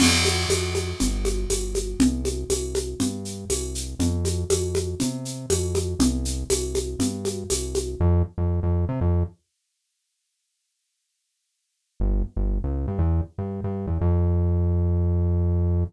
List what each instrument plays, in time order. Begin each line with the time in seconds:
0.00 synth bass 1 F2, crash, low conga, shaker
0.25 high conga, shaker
0.49 synth bass 1 F2, tambourine, high conga, shaker
0.75 high conga, shaker
1.00 synth bass 1 G1, low conga, shaker
1.25 high conga, shaker
1.50 synth bass 1 G1, tambourine, high conga, shaker
1.75 high conga, shaker
1.99 synth bass 1 C2, low conga, shaker
2.25 high conga, shaker
2.50 synth bass 1 C2, tambourine, high conga, shaker
2.75 high conga, shaker
3.00 synth bass 1 G2, low conga, shaker
3.25 shaker
3.50 synth bass 1 C2, tambourine, high conga, shaker
3.75 shaker
3.99 synth bass 1 F2, low conga, shaker
4.25 high conga, shaker
4.50 synth bass 1 F2, tambourine, high conga, shaker
4.75 high conga, shaker
5.00 synth bass 1 C3, low conga, shaker
5.25 shaker
5.50 synth bass 1 F2, tambourine, high conga, shaker
5.75 high conga, shaker
5.99 synth bass 1 C2, low conga, shaker
6.25 shaker
6.50 synth bass 1 C2, tambourine, high conga, shaker
6.75 high conga, shaker
6.99 synth bass 1 G2, low conga, shaker
7.25 high conga, shaker
7.50 synth bass 1 C2, tambourine, high conga, shaker
7.75 high conga, shaker
8.00 synth bass 1 F2
8.38 synth bass 1 F2
8.63 synth bass 1 F2
8.89 synth bass 1 C3
9.01 synth bass 1 F2
12.00 synth bass 1 G1
12.36 synth bass 1 G1
12.64 synth bass 1 C#2
12.88 synth bass 1 G2
12.99 synth bass 1 E2
13.38 synth bass 1 G2
13.64 synth bass 1 G2
13.87 synth bass 1 E2
14.01 synth bass 1 F2